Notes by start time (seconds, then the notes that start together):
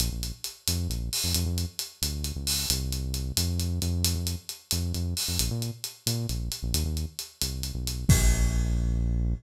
0.00 A#1, closed hi-hat
0.12 A#1
0.23 closed hi-hat
0.44 closed hi-hat
0.68 F2, closed hi-hat
0.89 A#1, closed hi-hat
1.13 open hi-hat
1.24 F2
1.34 F2, closed hi-hat
1.46 F2
1.58 closed hi-hat
1.79 closed hi-hat
2.02 D2, closed hi-hat
2.24 closed hi-hat
2.36 C#2
2.47 open hi-hat
2.70 C2, closed hi-hat
2.92 closed hi-hat
3.14 closed hi-hat
3.37 F2, closed hi-hat
3.60 closed hi-hat
3.82 F2, closed hi-hat
4.04 closed hi-hat
4.15 F2
4.27 closed hi-hat
4.49 closed hi-hat
4.71 F2, closed hi-hat
4.94 F2, closed hi-hat
5.17 open hi-hat
5.28 F2
5.39 A#1, closed hi-hat
5.51 A#2
5.62 closed hi-hat
5.84 closed hi-hat
6.06 A#2, closed hi-hat
6.29 A#1, closed hi-hat
6.52 closed hi-hat
6.63 A#1
6.74 D#2, closed hi-hat
6.85 D#2
6.97 closed hi-hat
7.19 closed hi-hat
7.42 C2, closed hi-hat
7.63 closed hi-hat
7.75 B1
7.87 closed hi-hat
8.09 A#1, kick, crash